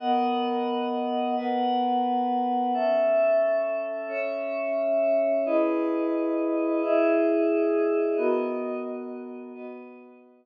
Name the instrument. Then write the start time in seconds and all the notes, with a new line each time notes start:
pad 5 (bowed)
0.00 B3 A#4 D#5 F#5
1.36 B3 A#4 B4 F#5
2.74 C#4 A4 E5
4.08 C#4 C#5 E5
5.46 E4 G#4 B4 D#5
6.82 E4 G#4 D#5 E5
8.17 B3 F#4 A#4 D#5
9.54 B3 F#4 B4 D#5